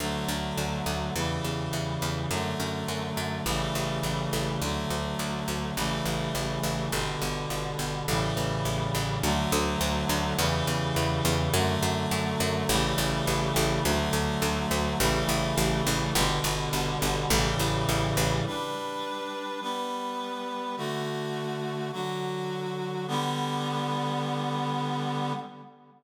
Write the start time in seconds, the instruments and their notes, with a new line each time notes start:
0.00 electric bass (finger) D2, clarinet D3 F#3 A3
0.28 electric bass (finger) D2
0.58 electric bass (finger) D2
0.86 electric bass (finger) D2
1.15 electric bass (finger) E2, clarinet C#3 E3 G3
1.44 electric bass (finger) E2
1.73 electric bass (finger) E2
2.02 electric bass (finger) E2
2.31 electric bass (finger) F#2, clarinet D3 F#3 A3
2.60 electric bass (finger) F#2
2.88 electric bass (finger) F#2
3.17 electric bass (finger) F#2
3.46 electric bass (finger) A1, clarinet C#3 E3 G3 A3
3.75 electric bass (finger) A1
4.03 electric bass (finger) A1
4.33 electric bass (finger) A1
4.62 electric bass (finger) D2, clarinet D3 F#3 A3
4.90 electric bass (finger) D2
5.19 electric bass (finger) D2
5.48 electric bass (finger) D2
5.77 electric bass (finger) A1, clarinet C#3 E3 G3 A3
6.06 electric bass (finger) A1
6.35 electric bass (finger) A1
6.63 electric bass (finger) A1
6.92 electric bass (finger) G1, clarinet B2 D3 G3
7.22 electric bass (finger) G1
7.50 electric bass (finger) G1
7.79 electric bass (finger) G1
8.08 electric bass (finger) A1, clarinet A2 C#3 E3 G3
8.37 electric bass (finger) A1
8.65 electric bass (finger) A1
8.95 electric bass (finger) A1
9.23 electric bass (finger) D2, clarinet D3 F#3 A3
9.52 electric bass (finger) D2
9.81 electric bass (finger) D2
10.09 electric bass (finger) D2
10.38 electric bass (finger) E2, clarinet C#3 E3 G3
10.67 electric bass (finger) E2
10.96 electric bass (finger) E2
11.25 electric bass (finger) E2
11.53 electric bass (finger) F#2, clarinet D3 F#3 A3
11.83 electric bass (finger) F#2
12.11 electric bass (finger) F#2
12.40 electric bass (finger) F#2
12.69 electric bass (finger) A1, clarinet C#3 E3 G3 A3
12.98 electric bass (finger) A1
13.27 electric bass (finger) A1
13.56 electric bass (finger) A1
13.85 electric bass (finger) D2, clarinet D3 F#3 A3
14.13 electric bass (finger) D2
14.42 electric bass (finger) D2
14.71 electric bass (finger) D2
15.00 electric bass (finger) A1, clarinet C#3 E3 G3 A3
15.29 electric bass (finger) A1
15.58 electric bass (finger) A1
15.87 electric bass (finger) A1
16.15 electric bass (finger) G1, clarinet B2 D3 G3
16.44 electric bass (finger) G1
16.73 electric bass (finger) G1
17.02 electric bass (finger) G1
17.30 electric bass (finger) A1, clarinet A2 C#3 E3 G3
17.59 electric bass (finger) A1
17.89 electric bass (finger) A1
18.17 electric bass (finger) A1
18.46 clarinet G3 D4 B4
19.62 clarinet G3 B3 B4
20.77 clarinet D3 A3 F#4
21.92 clarinet D3 F#3 F#4
23.08 clarinet D3 G3 B3